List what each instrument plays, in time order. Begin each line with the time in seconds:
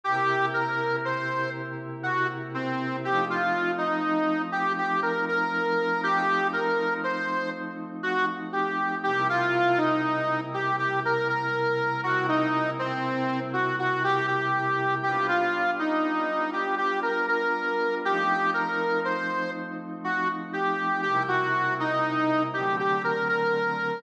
0.04 pad 5 (bowed) C3 A#3 E4 G4, harmonica G4
0.54 harmonica A#4
1.05 harmonica C5
2.03 harmonica F#4
2.54 harmonica C4
3.04 pad 5 (bowed) F3 A3 C4 D#4, harmonica G4
3.30 harmonica F4
3.78 harmonica D#4
4.52 harmonica G4
4.78 harmonica G4
5.03 harmonica A#4
5.29 harmonica A#4
6.03 pad 5 (bowed) F3 A3 C4 D#4, harmonica G4
6.53 harmonica A#4
7.04 harmonica C5
8.03 harmonica F#4
8.53 harmonica G4
9.04 pad 5 (bowed) C3 G3 A#3 E4, harmonica G4
9.30 harmonica F4
9.78 harmonica D#4
10.54 harmonica G4
10.79 harmonica G4
11.05 harmonica A#4
11.29 harmonica A#4
12.04 pad 5 (bowed) C3 G3 A#3 E4, harmonica F#4
12.29 harmonica D#4
12.79 harmonica C4
13.53 harmonica F#4
13.79 harmonica F#4
14.04 harmonica G4
14.27 harmonica G4
15.03 pad 5 (bowed) G3 B3 D4 F4, harmonica G4
15.28 harmonica F4
15.79 harmonica D#4
16.53 harmonica G4
16.78 harmonica G4
17.02 harmonica A#4
17.28 harmonica A#4
18.04 pad 5 (bowed) F3 A3 C4 D#4, harmonica G4
18.54 harmonica A#4
19.05 harmonica C5
20.04 harmonica F#4
20.53 harmonica G4
21.02 pad 5 (bowed) C3 G3 A#3 E4, harmonica G4
21.28 harmonica F#4
21.80 harmonica D#4
22.54 pad 5 (bowed) D3 F#3 A3 C4, harmonica G4
22.79 harmonica G4
23.04 harmonica A#4
23.29 harmonica A#4